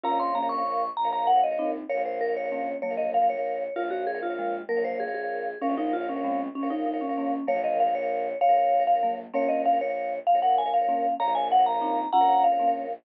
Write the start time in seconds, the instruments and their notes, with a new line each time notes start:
0.03 violin A#1, marimba C#4 F4, vibraphone A#4 C#5 F5 A#5
0.11 vibraphone A#4 C#5 F5
0.19 vibraphone A#4 C#5 F5 C6
0.35 marimba A#3 C#4, vibraphone A#5
0.42 vibraphone A#4 C#5 F5
0.49 vibraphone C#6
0.58 vibraphone A#4 C#5 F5
0.97 violin A#1, vibraphone A#5
1.04 vibraphone A#4 C#5 F5
1.12 vibraphone A#4 C#5 F5 A#5
1.27 vibraphone F#5
1.36 vibraphone A#4 C#5 F5
1.44 vibraphone D#5
1.51 vibraphone A#4 C#5 F5
1.59 marimba C4 D#4
1.89 violin A#1, vibraphone A#4 C#5 F5
1.97 vibraphone A#4 C#5 F5
2.05 vibraphone A#4 C5 C#5 F5
2.21 vibraphone A#4
2.29 vibraphone A#4 C#5 F5
2.36 vibraphone C#5
2.44 vibraphone A#4 C#5 F5
2.52 marimba A#3 C#4
2.82 violin A#1, marimba F#3 A#3, vibraphone C#5
2.90 vibraphone A#4 C#5 F5
2.97 vibraphone A#4 C#5 D#5 F5
3.14 vibraphone F5
3.22 vibraphone A#4 C#5 F5
3.30 vibraphone C#5
3.37 vibraphone A#4 C#5 F5
3.76 violin A#1, vibraphone F4 A#4 C#5 F5
3.84 vibraphone A#4 C#5 F5
3.90 vibraphone F#4 A#4 C#5 F5
4.07 vibraphone G#4
4.15 vibraphone A#4 C#5 F5
4.23 vibraphone F4
4.30 vibraphone A#4 C#5 F5
4.39 marimba F3 G#3
4.69 violin A#1, marimba F#3 A#3, vibraphone A#4
4.77 vibraphone A#4 C#5 F5
4.84 vibraphone A#4 C5 C#5 F5
5.00 vibraphone G#4
5.08 vibraphone A#4 C#5 F5
5.14 vibraphone G#4
5.23 vibraphone A#4 C#5 F5
5.61 violin A#1, vibraphone C#4 A#4 C#5 F5
5.70 vibraphone A#4 C#5 F5
5.77 vibraphone D#4 A#4 C#5 F5
5.93 vibraphone F4
6.01 vibraphone A#4 C#5 F5
6.09 vibraphone C#4
6.16 vibraphone A#4 C#5 F5
6.24 marimba G#3 C4
6.55 violin A#1, vibraphone C#4
6.63 vibraphone A#4 C#5 F5
6.70 vibraphone D#4 A#4 C#5 F5
6.86 vibraphone D#4
6.94 vibraphone A#4 C#5 F5
7.01 vibraphone C#4
7.09 vibraphone A#4 C#5 F5
7.18 marimba A#3 C#4
7.47 violin A#1, marimba F#3 A#3, vibraphone A#4 C#5 F5
7.56 vibraphone A#4 C#5 F5
7.64 vibraphone A#4 C#5 D#5 F5
7.80 vibraphone F5
7.87 vibraphone A#4 C#5 F5
7.95 vibraphone C#5
8.02 vibraphone A#4 C#5 F5
8.41 violin A#1, vibraphone C#5 F5
8.49 vibraphone A#4 C#5 F5
8.57 vibraphone A#4 C#5 F5
8.80 vibraphone A#4 C#5 F5
8.87 vibraphone F5
8.95 vibraphone A#4 C#5 F5
9.03 marimba F#3 A#3
9.34 violin A#1, marimba A#3 C#4, vibraphone A#4 C#5 F5
9.42 vibraphone A#4 C#5 F5
9.49 vibraphone A#4 C#5 D#5 F5
9.66 vibraphone F5
9.73 vibraphone A#4 C#5 F5
9.81 vibraphone C#5
9.88 vibraphone A#4 C#5 F5
10.27 violin A#1, vibraphone F5
10.35 vibraphone A#4 C#5 F5
10.42 vibraphone A#4 C#5 F5 F#5
10.58 vibraphone G#5
10.66 vibraphone A#4 C#5 F5
10.74 vibraphone F5
10.81 vibraphone A#4 C#5 F5
10.88 marimba A#3 C#4
11.20 violin A#1, vibraphone A#4 C#5 F5 A#5
11.28 vibraphone A#4 C#5 F5
11.35 vibraphone A#4 C#5 F5 G#5
11.52 vibraphone F#5
11.59 vibraphone A#4 C#5 F5
11.66 vibraphone A#5
11.74 vibraphone A#4 C#5 F5
11.81 marimba C4 D#4
12.13 violin A#1, marimba C#4 F4, vibraphone F#5 A#5
12.21 vibraphone A#4 C#5 F5
12.28 vibraphone A#4 C#5 F5
12.44 vibraphone F5
12.52 vibraphone A#4 C#5 F5
12.59 marimba A#3 C#4
12.67 vibraphone A#4 C#5 F5